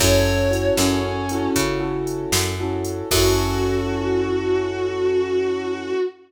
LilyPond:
<<
  \new Staff \with { instrumentName = "Distortion Guitar" } { \time 12/8 \key fis \minor \tempo 4. = 77 cis''4. cis'4. r2. | fis'1. | }
  \new Staff \with { instrumentName = "Acoustic Grand Piano" } { \time 12/8 \key fis \minor <cis' e' fis' a'>4 <cis' e' fis' a'>4. <cis' e' fis' a'>4 <cis' e' fis' a'>4. <cis' e' fis' a'>4 | <cis' e' fis' a'>1. | }
  \new Staff \with { instrumentName = "Electric Bass (finger)" } { \clef bass \time 12/8 \key fis \minor fis,4. fis,4. cis4. fis,4. | fis,1. | }
  \new DrumStaff \with { instrumentName = "Drums" } \drummode { \time 12/8 <cymc bd>4 hh8 sn4 hh8 <hh bd>4 hh8 sn4 hh8 | <cymc bd>4. r4. r4. r4. | }
>>